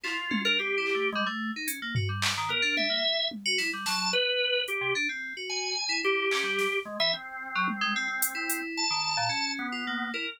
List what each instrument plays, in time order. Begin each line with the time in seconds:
0.04 electric piano 2 E4, drawbar organ F4, clap
0.31 electric piano 2 C#4, high tom
0.45 electric piano 2 D4, drawbar organ A#4
0.59 electric piano 2 C4, drawbar organ G4
0.78 electric piano 2 E4
0.86 clap
0.95 electric piano 2 A3
1.12 electric piano 2 G3, drawbar organ G#3
1.26 electric piano 2 A3
1.56 electric piano 2 D#4
1.67 electric piano 2 C#4, closed hi-hat
1.82 electric piano 2 A#3
1.95 electric piano 2 F#4, floor tom
2.09 electric piano 2 G3
2.22 clap
2.38 electric piano 2 D#3
2.49 electric piano 2 B3, drawbar organ A#4
2.62 electric piano 2 D4
2.77 drawbar organ E5, high tom
2.90 electric piano 2 A#3
3.31 high tom
3.46 electric piano 2 F#4
3.58 electric piano 2 E4, snare
3.73 electric piano 2 G3
3.86 electric piano 2 F#3, drawbar organ A5, snare
4.13 drawbar organ B4
4.68 drawbar organ G4, closed hi-hat
4.81 electric piano 2 C3
4.95 electric piano 2 D4
5.09 electric piano 2 C4
5.37 electric piano 2 F#4
5.49 drawbar organ G#5
5.89 electric piano 2 E4
6.03 electric piano 2 E4, drawbar organ G4
6.31 electric piano 2 C#4, clap
6.43 electric piano 2 G3
6.59 snare
6.85 drawbar organ G#3
7.00 electric piano 2 E3, drawbar organ E5
7.13 drawbar organ C4
7.55 electric piano 2 F#3
7.68 high tom
7.81 electric piano 2 G#3
7.96 electric piano 2 C4
8.08 electric piano 2 C4
8.22 closed hi-hat
8.35 electric piano 2 E4
8.50 closed hi-hat
8.77 drawbar organ A5
8.90 electric piano 2 D#3
9.17 electric piano 2 A#2
9.29 electric piano 2 C#4
9.59 drawbar organ B3
9.72 electric piano 2 F4
9.87 electric piano 2 A#3
10.14 electric piano 2 E4, drawbar organ A#4